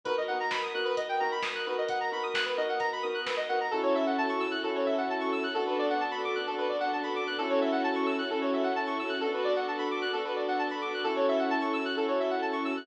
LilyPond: <<
  \new Staff \with { instrumentName = "Electric Piano 2" } { \time 4/4 \key fis \minor \tempo 4 = 131 <b dis' fis' ais'>8 <b dis' fis' ais'>4 <b dis' fis' ais'>4 <b dis' fis' ais'>4 <b dis' fis' ais'>8~ | <b dis' fis' ais'>8 <b dis' fis' ais'>4 <b dis' fis' ais'>4 <b dis' fis' ais'>4 <b dis' fis' ais'>8 | <cis' e' fis' a'>2 <cis' e' fis' a'>2 | <b d' fis' a'>2 <b d' fis' a'>2 |
<cis' e' fis' a'>2 <cis' e' fis' a'>2 | <b d' fis' a'>2 <b d' fis' a'>2 | <cis' e' fis' a'>2 <cis' e' fis' a'>2 | }
  \new Staff \with { instrumentName = "Lead 1 (square)" } { \time 4/4 \key fis \minor b'16 dis''16 fis''16 ais''16 b''16 dis'''16 fis'''16 b'16 dis''16 g''16 ais''16 b''16 dis'''16 fis'''16 b'16 dis''16 | fis''16 ais''16 b''16 dis'''16 fis'''16 b'16 dis''16 fis''16 ais''16 b''16 dis'''16 fis'''16 b'16 dis''16 fis''16 ais''16 | a'16 cis''16 e''16 fis''16 a''16 cis'''16 e'''16 fis'''16 a'16 cis''16 e''16 fis''16 a''16 cis'''16 e'''16 fis'''16 | a'16 b'16 d''16 fis''16 a''16 b''16 d'''16 fis'''16 a'16 b'16 d''16 fis''16 a''16 b''16 d'''16 fis'''16 |
a'16 cis''16 e''16 fis''16 a''16 cis'''16 e'''16 fis'''16 a'16 cis''16 e''16 fis''16 a''16 cis'''16 e'''16 fis'''16 | a'16 b'16 d''16 fis''16 a''16 b''16 d'''16 fis'''16 a'16 b'16 d''16 fis''16 a''16 b''16 d'''16 fis'''16 | a'16 cis''16 e''16 fis''16 a''16 cis'''16 e'''16 fis'''16 a'16 cis''16 e''16 fis''16 a''16 cis'''16 e'''16 fis'''16 | }
  \new Staff \with { instrumentName = "Synth Bass 2" } { \clef bass \time 4/4 \key fis \minor b,,1 | b,,1 | fis,8 fis,8 fis,8 fis,8 fis,8 fis,8 fis,8 fis,8 | fis,8 fis,8 fis,8 fis,8 fis,8 fis,8 fis,8 fis,8 |
fis,8 fis,8 fis,8 fis,8 fis,8 fis,8 fis,8 fis,8 | b,,8 b,,8 b,,8 b,,8 b,,8 b,,8 b,,8 b,,8 | fis,8 fis,8 fis,8 fis,8 fis,8 fis,8 fis,8 fis,8 | }
  \new Staff \with { instrumentName = "String Ensemble 1" } { \time 4/4 \key fis \minor <b dis' fis' ais'>1~ | <b dis' fis' ais'>1 | <cis' e' fis' a'>1 | <b d' fis' a'>1 |
<cis' e' fis' a'>1 | <b d' fis' a'>1 | <cis' e' fis' a'>1 | }
  \new DrumStaff \with { instrumentName = "Drums" } \drummode { \time 4/4 <hh bd>4 <bd sn>4 <hh bd>4 <bd sn>4 | <hh bd>4 <bd sn>4 <hh bd>4 <bd sn>4 | r4 r4 r4 r4 | r4 r4 r4 r4 |
r4 r4 r4 r4 | r4 r4 r4 r4 | r4 r4 r4 r4 | }
>>